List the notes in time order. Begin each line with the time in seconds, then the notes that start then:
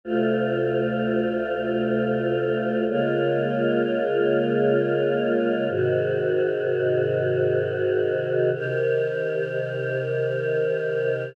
0.04 D2 C3 A3 F4
2.88 C#3 G#3 A#3 F4
5.69 G#2 C3 D#3 F#4
8.53 C3 D#3 G4 A#4